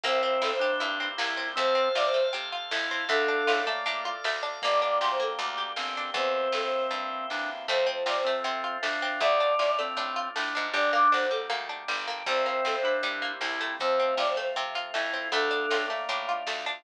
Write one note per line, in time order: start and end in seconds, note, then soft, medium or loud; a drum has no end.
0.04 0.38 C2 medium
0.04 1.55 A#3 medium
0.04 0.22 A#3 medium
0.04 1.55 C4 medium
0.04 0.52 C4 medium
0.04 1.55 E4 medium
0.04 1.55 G4 medium
0.04 0.20 C5 medium
0.04 kick medium
0.04 closed hi-hat medium
0.23 0.40 C4 medium
0.23 0.40 C5 medium
0.42 0.76 G2 medium
0.42 0.59 E4 medium
0.42 0.51 A4 medium
0.42 snare medium
0.52 0.61 C5 medium
0.59 1.09 D4 medium
0.59 0.79 G4 medium
0.59 0.70 C5 medium
0.80 1.15 G2 medium
0.80 0.97 E4 medium
0.80 closed hi-hat medium
1.00 1.17 C4 medium
1.18 1.53 C2 medium
1.18 1.35 A#3 medium
1.18 1.49 E4 medium
1.18 snare loud
1.37 1.54 C4 medium
1.56 1.92 F2 medium
1.56 1.74 A3 medium
1.56 1.89 C4 loud
1.56 3.09 A4 medium
1.56 1.75 C5 loud
1.56 3.09 C5 medium
1.56 3.09 F5 medium
1.56 kick medium
1.56 closed hi-hat medium
1.75 1.92 C4 medium
1.75 1.92 C5 medium
1.95 2.30 C3 medium
1.95 2.13 F4 medium
1.95 2.05 D5 loud
1.95 snare medium
2.05 2.14 C5 medium
2.14 2.31 A3 medium
2.14 2.23 C5 loud
2.33 2.68 C3 medium
2.33 2.50 C4 medium
2.33 closed hi-hat medium
2.52 2.70 F4 medium
2.71 3.06 F2 medium
2.71 2.89 A3 medium
2.71 3.05 E4 medium
2.71 snare loud
2.91 3.08 C4 medium
3.09 3.43 D2 medium
3.09 3.27 A3 medium
3.09 3.62 D4 medium
3.09 3.59 A4 loud
3.09 4.62 A4 medium
3.09 4.62 D5 medium
3.09 4.62 F5 medium
3.09 kick medium
3.09 closed hi-hat medium
3.28 3.45 D4 medium
3.47 3.83 A2 medium
3.47 3.65 F4 medium
3.47 snare medium
3.66 3.84 A3 medium
3.66 4.12 A#3 medium
3.86 4.21 A2 medium
3.86 4.03 D4 medium
3.86 closed hi-hat medium
4.05 4.22 F4 medium
4.24 4.59 D2 medium
4.24 4.42 A3 medium
4.24 snare medium
4.43 4.60 D4 medium
4.62 4.99 G1 medium
4.62 4.80 A#3 medium
4.62 6.15 A#3 medium
4.62 5.69 A#3 medium
4.62 6.15 D4 medium
4.62 6.15 G4 medium
4.62 4.81 D5 loud
4.62 kick medium
4.62 closed hi-hat medium
4.81 4.99 D4 medium
4.81 4.99 D5 medium
5.00 5.35 D2 medium
5.00 5.19 G4 medium
5.00 5.09 C6 medium
5.00 snare medium
5.11 5.20 C5 medium
5.20 5.37 A#3 medium
5.20 5.30 A4 medium
5.39 5.73 D2 medium
5.39 5.56 D4 medium
5.39 closed hi-hat loud
5.58 5.75 G4 medium
5.76 6.11 G1 medium
5.76 5.94 A#3 medium
5.76 6.11 C4 medium
5.76 snare medium
5.97 6.14 D4 medium
6.14 6.48 E2 loud
6.14 7.67 A#3 medium
6.14 7.67 C4 medium
6.14 7.27 C4 medium
6.14 7.67 E4 medium
6.14 7.67 G4 medium
6.14 6.33 C5 medium
6.14 kick medium
6.14 closed hi-hat medium
6.35 6.52 C5 medium
6.52 6.87 G2 medium
6.52 6.62 A4 medium
6.52 snare medium
6.63 6.72 C5 medium
6.73 6.82 C5 medium
6.91 7.25 G2 medium
6.91 closed hi-hat medium
7.30 7.65 E2 medium
7.30 7.50 D4 medium
7.30 snare medium
7.68 8.04 F2 medium
7.68 7.85 A3 medium
7.68 9.20 A3 medium
7.68 9.20 C4 medium
7.68 9.20 F4 medium
7.68 7.86 C5 loud
7.68 kick medium
7.68 closed hi-hat medium
7.87 8.04 C4 medium
7.87 8.03 C5 medium
8.06 8.40 C3 medium
8.06 8.24 F4 medium
8.06 8.16 D5 medium
8.06 snare medium
8.16 8.25 C5 medium
8.24 8.44 A3 medium
8.24 8.78 C4 medium
8.24 8.34 C4 medium
8.44 8.79 C3 medium
8.44 8.62 C4 medium
8.44 closed hi-hat medium
8.64 8.81 F4 medium
8.83 9.18 F2 medium
8.83 9.00 A3 medium
8.83 9.20 D4 medium
8.83 snare medium
9.02 9.20 C4 medium
9.20 9.55 D2 medium
9.20 10.72 A3 medium
9.20 9.39 A3 medium
9.20 10.72 D4 medium
9.20 10.72 F4 medium
9.20 9.77 D5 loud
9.20 kick medium
9.20 closed hi-hat medium
9.40 9.57 D4 medium
9.59 9.94 A2 medium
9.59 9.76 F4 medium
9.59 snare medium
9.79 9.96 A3 medium
9.79 10.29 C4 medium
9.97 10.31 A2 medium
9.97 10.15 D4 medium
9.97 closed hi-hat medium
10.16 10.33 F4 medium
10.36 10.54 A2 medium
10.36 10.53 A3 medium
10.36 10.67 D4 medium
10.36 snare medium
10.55 10.74 G#2 medium
10.55 10.72 D4 medium
10.73 11.08 G1 medium
10.73 10.91 G3 medium
10.73 12.25 G3 medium
10.73 12.25 A#3 medium
10.73 11.26 D4 medium
10.73 12.25 D4 medium
10.73 10.90 D5 loud
10.73 kick medium
10.73 closed hi-hat medium
10.92 11.10 A#3 medium
10.92 11.09 D6 medium
11.12 11.48 D2 medium
11.12 11.29 D4 medium
11.12 11.21 C5 medium
11.12 snare medium
11.21 11.31 C5 medium
11.31 11.48 G3 medium
11.31 11.40 A4 medium
11.50 11.84 D2 medium
11.50 11.67 A#3 medium
11.50 closed hi-hat medium
11.69 11.86 D4 medium
11.88 12.23 G1 medium
11.88 12.05 G3 medium
11.88 snare medium
12.08 12.25 A#3 medium
12.26 12.61 C2 medium
12.26 13.78 G3 medium
12.26 12.45 G3 medium
12.26 13.78 A#3 medium
12.26 13.78 C4 medium
12.26 12.76 C4 medium
12.26 13.78 E4 medium
12.26 12.42 C5 medium
12.26 kick medium
12.26 closed hi-hat medium
12.46 12.63 A#3 medium
12.46 12.64 C5 medium
12.65 13.00 G2 medium
12.65 12.82 C4 medium
12.65 12.74 A4 medium
12.65 snare medium
12.74 12.83 C5 medium
12.83 13.32 D4 medium
12.83 13.02 E4 medium
12.83 12.93 C5 medium
13.03 13.37 G2 medium
13.03 13.20 G3 medium
13.03 closed hi-hat medium
13.22 13.39 A#3 medium
13.41 13.75 C2 medium
13.41 13.59 C4 medium
13.41 13.73 E4 medium
13.41 snare medium
13.61 13.97 A3 medium
13.79 14.15 F2 medium
13.79 15.31 A3 medium
13.79 15.31 C4 medium
13.79 14.15 C4 medium
13.79 15.31 F4 medium
13.79 13.99 C5 loud
13.79 kick medium
13.79 closed hi-hat medium
13.99 14.16 C4 medium
13.99 14.17 C4 medium
14.17 14.52 C3 medium
14.17 14.35 F4 medium
14.17 14.27 D5 medium
14.17 snare medium
14.27 14.36 C5 medium
14.37 14.54 A3 medium
14.37 14.46 C5 medium
14.56 14.91 C3 medium
14.56 14.73 C4 medium
14.75 14.92 F4 medium
14.75 closed hi-hat medium
14.94 15.29 F2 medium
14.94 15.11 A3 medium
14.94 15.28 E4 medium
14.94 snare medium
15.13 15.31 C4 medium
15.32 15.66 D2 medium
15.32 15.50 A3 medium
15.32 16.84 A3 medium
15.32 15.86 D4 medium
15.32 16.84 D4 medium
15.32 16.84 F4 medium
15.32 15.81 A4 loud
15.32 kick medium
15.32 closed hi-hat medium
15.51 15.68 D4 medium
15.71 16.05 A2 medium
15.71 15.88 F4 medium
15.71 snare medium
15.88 16.07 A3 medium
15.88 16.34 A#3 medium
16.09 16.43 A2 medium
16.09 16.27 D4 medium
16.09 closed hi-hat medium
16.29 16.46 F4 medium
16.47 16.81 D2 medium
16.47 16.65 A3 medium
16.47 snare medium
16.66 16.83 D4 medium